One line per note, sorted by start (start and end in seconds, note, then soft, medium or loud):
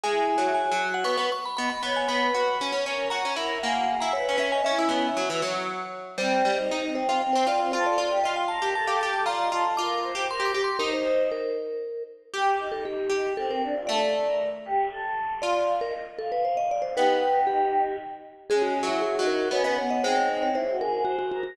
0.04 0.31 G#3 loud
0.04 0.47 E4 medium
0.04 0.47 G#4 medium
0.04 0.27 G#5 medium
0.38 0.67 F#3 medium
0.54 0.87 G#5 medium
0.72 1.04 F#3 loud
0.94 1.06 F#5 medium
1.04 1.17 B3 loud
1.04 1.26 C#6 medium
1.17 1.30 B3 loud
1.32 1.44 C#6 medium
1.46 1.56 B5 medium
1.57 1.71 B3 loud
1.57 1.69 D#5 medium
1.57 1.69 B5 medium
1.70 1.82 B5 medium
1.83 2.07 B3 medium
1.83 2.05 C#5 medium
1.83 1.96 B5 medium
1.96 2.09 G#5 medium
2.08 2.31 B3 medium
2.08 2.33 B4 medium
2.08 2.76 B5 medium
2.34 2.57 F#4 loud
2.34 2.55 B4 medium
2.61 2.72 C#4 loud
2.72 2.85 C#4 loud
2.85 3.08 C#4 medium
2.85 3.10 A#4 medium
3.10 3.23 F#4 loud
3.10 3.34 A#5 medium
3.25 3.37 C#4 medium
3.36 3.57 E4 loud
3.36 3.59 A#4 medium
3.63 3.96 A#3 loud
3.63 3.75 G#4 medium
3.63 3.98 F#5 medium
3.75 3.88 F#4 medium
3.88 4.10 G#4 medium
4.00 4.14 E4 medium
4.00 4.13 A#5 medium
4.13 4.26 B4 medium
4.13 4.36 C#5 medium
4.26 4.37 C#4 loud
4.26 4.49 B4 medium
4.38 4.61 C#4 loud
4.38 4.52 E5 medium
4.52 4.64 D#5 medium
4.52 4.64 G#5 medium
4.65 5.07 C#4 medium
4.65 4.78 C#4 loud
4.65 5.07 E4 medium
4.65 5.53 E5 medium
4.79 4.91 E4 loud
4.89 5.10 B3 medium
5.17 5.29 F#3 medium
5.30 5.42 E3 loud
5.42 6.17 F#3 loud
6.18 6.42 G3 loud
6.18 6.48 C4 medium
6.18 6.84 C5 medium
6.45 6.57 G3 medium
6.53 6.81 D#4 medium
6.71 7.06 D#4 medium
6.88 7.17 C4 medium
6.95 7.07 C5 medium
7.09 7.21 F4 medium
7.09 7.21 C5 medium
7.22 7.47 C4 medium
7.33 7.48 C4 medium
7.33 7.45 C5 medium
7.47 7.60 C4 medium
7.47 7.72 F4 loud
7.47 7.60 D5 medium
7.60 7.72 C4 medium
7.72 7.97 F4 loud
7.72 7.85 A4 medium
7.72 7.84 C5 medium
7.86 7.98 A4 medium
7.86 7.98 D5 medium
7.98 8.10 F4 medium
7.98 8.20 D5 medium
8.11 8.23 G4 medium
8.24 8.59 F4 medium
8.24 8.36 D#5 medium
8.36 8.49 G5 medium
8.48 8.74 A#4 medium
8.48 8.69 A5 medium
8.62 8.74 G4 medium
8.75 9.25 A4 medium
8.75 8.88 A5 medium
8.88 9.00 G4 medium
8.88 9.00 F5 medium
9.01 9.25 G4 medium
9.01 9.25 A5 medium
9.26 9.49 F4 loud
9.26 9.39 D5 loud
9.26 9.68 A#5 medium
9.40 9.52 D#5 medium
9.52 9.64 F4 medium
9.52 9.76 A4 medium
9.77 10.15 F4 loud
9.77 9.99 A#4 medium
9.77 10.24 D6 medium
10.03 10.25 C5 medium
10.15 10.27 G4 loud
10.29 10.51 A#4 medium
10.29 10.47 C6 medium
10.40 10.52 G4 medium
10.46 10.62 D6 medium
10.54 10.77 G4 loud
10.64 10.80 C6 medium
10.79 12.25 D#4 loud
10.79 10.91 A#4 medium
10.79 11.23 C5 medium
10.79 11.23 D#5 medium
10.93 11.29 C5 medium
11.32 12.03 A#4 medium
12.34 13.09 G4 loud
12.34 12.59 G4 medium
12.60 12.83 D#4 medium
12.72 12.84 A4 medium
12.85 13.17 D#4 medium
12.85 13.34 G4 medium
13.10 13.58 G4 medium
13.37 13.60 C4 medium
13.37 13.49 A4 medium
13.51 13.63 A#4 medium
13.63 13.75 D4 medium
13.75 13.87 F4 medium
13.87 15.23 A3 loud
13.87 14.00 A4 medium
13.87 14.49 D5 medium
14.01 14.13 A4 medium
14.26 14.39 A#4 medium
14.65 14.88 G4 medium
14.91 15.33 A4 medium
15.42 16.70 F4 loud
15.42 15.73 D5 medium
15.42 15.54 F5 medium
15.54 15.67 F5 medium
15.81 15.93 A#4 medium
15.81 15.93 D#5 medium
16.18 16.31 A4 medium
16.18 16.41 F5 medium
16.32 16.44 B4 medium
16.45 16.57 C5 medium
16.45 16.89 F5 medium
16.57 16.69 D#5 medium
16.71 16.83 D5 medium
16.82 16.94 C5 medium
16.95 17.87 B3 loud
16.95 17.83 D#4 medium
16.95 17.83 G4 medium
16.95 17.40 B4 medium
17.47 17.96 G4 medium
18.49 18.82 G#3 loud
18.49 18.78 C#4 medium
18.49 18.62 G#4 medium
18.62 18.74 F#4 medium
18.83 19.16 F#3 loud
18.83 19.14 E4 medium
18.89 19.01 F#4 medium
19.02 19.24 G#4 medium
19.18 19.49 F#3 loud
19.18 19.50 D#4 medium
19.27 19.48 A#4 medium
19.51 19.63 B3 medium
19.51 19.73 C#4 medium
19.51 19.65 C#5 medium
19.64 19.76 B3 loud
19.64 19.77 D#5 medium
19.78 20.01 B3 medium
19.78 19.90 C#5 medium
19.90 20.03 D#5 medium
20.04 20.96 G#3 loud
20.04 20.49 C4 medium
20.04 20.49 D#4 medium
20.04 20.16 C5 medium
20.16 20.28 C#5 medium
20.43 20.55 C#5 medium
20.55 20.67 E4 medium
20.55 20.76 C5 medium
20.68 20.80 F#4 medium
20.80 20.92 G#4 medium
20.80 21.03 A#4 medium
20.93 21.05 G#4 medium
21.05 21.17 F#4 medium
21.05 21.29 C5 medium
21.19 21.31 F#4 medium
21.32 21.43 F#4 medium
21.32 21.44 A#4 medium
21.43 21.56 F#4 medium
21.43 21.56 A#4 medium